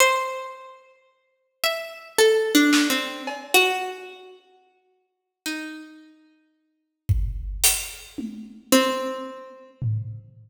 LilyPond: <<
  \new Staff \with { instrumentName = "Harpsichord" } { \time 5/4 \tempo 4 = 55 c''8. r8. e''8 \tuplet 3/2 { a'8 d'8 c'8 } r16 ges'4.~ ges'16 | ees'2. c'4 r4 | }
  \new DrumStaff \with { instrumentName = "Drums" } \drummode { \time 5/4 r4 r4 r8 sn8 cb4 r4 | r4 r8 bd8 hh8 tommh8 r4 tomfh4 | }
>>